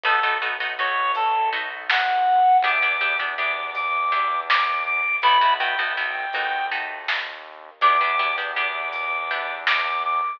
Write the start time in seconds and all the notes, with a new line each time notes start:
0.04 B1 A3 B3 D#4 F#4 A4, kick, closed hi-hat
0.23 A3 B3 D#4 F#4
0.41 A3 B3 D#4 F#4
0.60 A3 B3 D#4 F#4, closed hi-hat
0.78 A3 B3 D#4 F#4 C#5
1.15 A4, closed hi-hat
1.52 A3 B3 D#4 F#4
1.90 F#5, snare
2.63 E2 B3 D4 E4 G4 D6, kick, closed hi-hat
2.82 B3 D4 E4 G4
3.00 B3 D4 E4 G4
3.19 B3 D4 E4 G4, closed hi-hat
3.38 B3 D4 E4 G4 D6
3.75 D6, closed hi-hat
4.11 B3 D4 E4 G4
4.49 D6, snare
4.86 D6
5.22 B1 A3 B3 E4 F#4 B5, kick, closed hi-hat
5.41 A3 B3 E4 F#4
5.59 A3 B3 E4 F#4 G5
5.78 A3 B3 E4 F#4, closed hi-hat
5.97 A3 B3 E4 F#4
6.33 D#2 A3 B3 D#4 F#4, closed hi-hat
6.71 A3 B3 D#4 F#4
7.08 snare
7.81 E2 B3 D4 E4 G4 D6, kick, closed hi-hat
8.00 B3 D4 E4 G4
8.19 B3 D4 E4 G4
8.38 B3 D4 E4 G4, closed hi-hat
8.56 B3 D4 E4 G4 D6
8.93 D6, closed hi-hat
9.30 B3 D4 E4 G4
9.67 D6, snare
10.05 D6